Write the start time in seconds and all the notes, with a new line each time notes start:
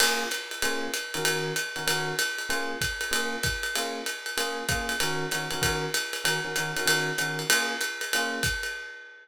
0.00 A#3 C#4 F4 G#4, crash, ride
0.31 hi-hat pedal, ride
0.51 ride
0.62 A#3 C#4 F4 G#4, ride
0.94 hi-hat pedal, ride
1.14 D#3 C#4 F#4 A#4, ride
1.25 ride
1.56 hi-hat pedal, ride
1.76 D#3 C#4 F#4 A#4, ride
1.87 D#3 C#4 F#4 A#4, ride
2.19 hi-hat pedal, ride
2.38 ride
2.49 A#3 C#4 F4 G#4, ride
2.81 kick, hi-hat pedal, ride
3.01 ride
3.11 A#3 C#4 F4 G#4, ride
3.43 kick, hi-hat pedal, ride
3.63 ride
3.76 A#3 C#4 F4 G#4, ride
4.06 hi-hat pedal, ride
4.26 ride
4.37 A#3 C#4 F4 G#4, ride
4.69 A#3 C#4 F4 G#4, kick, hi-hat pedal, ride
4.89 ride
5.00 D#3 C#4 F#4 A#4, ride
5.31 D#3 C#4 F#4 A#4, hi-hat pedal, ride
5.51 D#3 C#4 F#4 A#4, ride
5.61 D#3 C#4 F#4 A#4, kick, ride
5.94 hi-hat pedal, ride
6.13 ride
6.24 D#3 C#4 F#4 A#4, ride
6.44 D#3 C#4 F#4 A#4
6.56 D#3 C#4 F#4 A#4, hi-hat pedal, ride
6.76 D#3 C#4 F#4 A#4, ride
6.85 D#3 C#4 F#4 A#4, ride
7.18 D#3 C#4 F#4 A#4, hi-hat pedal, ride
7.39 ride
7.49 A#3 C#4 F4 G#4, ride
7.81 hi-hat pedal, ride
8.01 ride
8.13 A#3 C#4 F4 G#4, ride
8.43 kick, hi-hat pedal, ride
8.63 ride